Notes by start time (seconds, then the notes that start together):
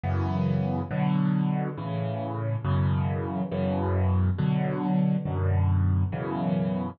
0.04 F#2 C#3 E3 B3
0.91 B2 D3 F#3
1.78 A2 C#3 E3
2.64 F#2 B2 C#3 E3
3.52 F#2 B2 C#3 E3
4.38 B2 D3 F#3
5.25 F#2 B2 D3
6.12 F#2 B2 C#3 E3